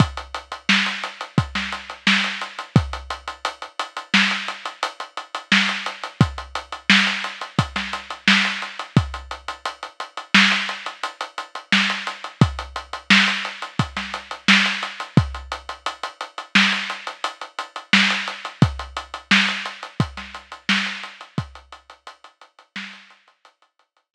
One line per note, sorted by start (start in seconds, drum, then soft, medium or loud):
0.00 kick medium
0.00 closed hi-hat loud
0.17 closed hi-hat medium
0.34 closed hi-hat medium
0.52 closed hi-hat medium
0.69 snare loud
0.86 closed hi-hat medium
1.03 closed hi-hat medium
1.21 closed hi-hat medium
1.38 kick medium
1.38 closed hi-hat medium
1.55 snare medium
1.55 closed hi-hat medium
1.72 closed hi-hat medium
1.90 closed hi-hat medium
2.07 snare loud
2.24 closed hi-hat medium
2.41 closed hi-hat medium
2.59 closed hi-hat medium
2.76 kick loud
2.76 closed hi-hat loud
2.93 closed hi-hat medium
3.10 closed hi-hat medium
3.28 closed hi-hat medium
3.45 closed hi-hat loud
3.62 closed hi-hat medium
3.79 closed hi-hat loud
3.97 closed hi-hat medium
4.14 snare loud
4.31 closed hi-hat medium
4.48 closed hi-hat medium
4.66 closed hi-hat medium
4.83 closed hi-hat loud
5.00 closed hi-hat medium
5.17 closed hi-hat medium
5.34 closed hi-hat medium
5.52 snare loud
5.69 closed hi-hat medium
5.86 closed hi-hat medium
6.03 closed hi-hat medium
6.21 kick loud
6.21 closed hi-hat loud
6.38 closed hi-hat medium
6.55 closed hi-hat medium
6.72 closed hi-hat medium
6.90 snare loud
7.07 closed hi-hat medium
7.24 closed hi-hat medium
7.41 closed hi-hat medium
7.59 kick medium
7.59 closed hi-hat loud
7.76 snare medium
7.76 closed hi-hat medium
7.93 closed hi-hat medium
8.10 closed hi-hat medium
8.28 snare loud
8.45 closed hi-hat medium
8.62 closed hi-hat medium
8.79 closed hi-hat medium
8.97 kick loud
8.97 closed hi-hat loud
9.14 closed hi-hat medium
9.31 closed hi-hat medium
9.48 closed hi-hat medium
9.65 closed hi-hat medium
9.83 closed hi-hat medium
10.00 closed hi-hat medium
10.17 closed hi-hat medium
10.34 snare loud
10.52 closed hi-hat medium
10.69 closed hi-hat medium
10.86 closed hi-hat medium
11.03 closed hi-hat loud
11.21 closed hi-hat medium
11.38 closed hi-hat medium
11.55 closed hi-hat medium
11.72 snare loud
11.90 closed hi-hat medium
12.07 closed hi-hat medium
12.24 closed hi-hat medium
12.41 kick loud
12.41 closed hi-hat loud
12.59 closed hi-hat medium
12.76 closed hi-hat medium
12.93 closed hi-hat medium
13.10 snare loud
13.28 closed hi-hat medium
13.45 closed hi-hat medium
13.62 closed hi-hat medium
13.79 kick medium
13.79 closed hi-hat loud
13.97 snare medium
13.97 closed hi-hat medium
14.14 closed hi-hat medium
14.31 closed hi-hat medium
14.48 snare loud
14.66 closed hi-hat medium
14.83 closed hi-hat medium
15.00 closed hi-hat medium
15.17 kick loud
15.17 closed hi-hat loud
15.34 closed hi-hat medium
15.52 closed hi-hat medium
15.69 closed hi-hat medium
15.86 closed hi-hat loud
16.03 closed hi-hat medium
16.21 closed hi-hat medium
16.38 closed hi-hat medium
16.55 snare loud
16.72 closed hi-hat medium
16.90 closed hi-hat medium
17.07 closed hi-hat medium
17.24 closed hi-hat loud
17.41 closed hi-hat medium
17.59 closed hi-hat medium
17.76 closed hi-hat medium
17.93 snare loud
18.10 closed hi-hat medium
18.28 closed hi-hat medium
18.45 closed hi-hat medium
18.62 kick loud
18.62 closed hi-hat loud
18.79 closed hi-hat medium
18.97 closed hi-hat medium
19.14 closed hi-hat medium
19.31 snare loud
19.48 closed hi-hat medium
19.66 closed hi-hat medium
19.83 closed hi-hat medium
20.00 kick medium
20.00 closed hi-hat loud
20.17 snare medium
20.17 closed hi-hat medium
20.34 closed hi-hat medium
20.52 closed hi-hat medium
20.69 snare loud
20.86 closed hi-hat medium
21.03 closed hi-hat medium
21.21 closed hi-hat medium
21.38 kick loud
21.38 closed hi-hat loud
21.55 closed hi-hat medium
21.72 closed hi-hat medium
21.90 closed hi-hat medium
22.07 closed hi-hat loud
22.24 closed hi-hat medium
22.41 closed hi-hat medium
22.59 closed hi-hat medium
22.76 snare loud
22.93 closed hi-hat medium
23.10 closed hi-hat medium
23.28 closed hi-hat medium
23.45 closed hi-hat loud
23.62 closed hi-hat medium
23.79 closed hi-hat medium
23.97 closed hi-hat medium
24.14 snare loud